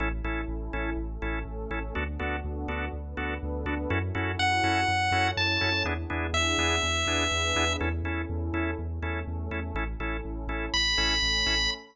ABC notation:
X:1
M:4/4
L:1/8
Q:1/4=123
K:A
V:1 name="Lead 1 (square)"
z8 | z8 | z2 f4 a2 | z2 e6 |
z8 | z4 b4 |]
V:2 name="Drawbar Organ"
[CEA] [CEA]2 [CEA]2 [CEA]2 [CEA] | [B,DFA] [B,DFA]2 [B,DFA]2 [B,DFA]2 [B,DFA] | [CEFA] [CEFA]2 [CEFA]2 [CEFA]2 [CEFA] | [B,DEG] [B,DEG]2 [B,DEG]2 [B,DEG]2 [B,DEG] |
[CEA] [CEA]2 [CEA]2 [CEA]2 [CEA] | [CEA] [CEA]2 [CEA]2 [CEA]2 [CEA] |]
V:3 name="Synth Bass 2" clef=bass
A,,, A,,, A,,, A,,, A,,, A,,, A,,, A,,, | D,, D,, D,, D,, D,, D,, D,, D,, | F,, F,, F,, F,, F,, F,, F,, F,, | E,, E,, E,, E,, E,, E,, E,, E,, |
E,, E,, E,, E,, E,, E,, E,, E,, | A,,, A,,, A,,, A,,, A,,, A,,, A,,, A,,, |]
V:4 name="Pad 2 (warm)"
[CEA]4 [A,CA]4 | [B,DFA]4 [B,DAB]4 | [CEFA]4 [CEAc]4 | [B,DEG]4 [B,DGB]4 |
[CEA]4 [A,CA]4 | [CEA]4 [A,CA]4 |]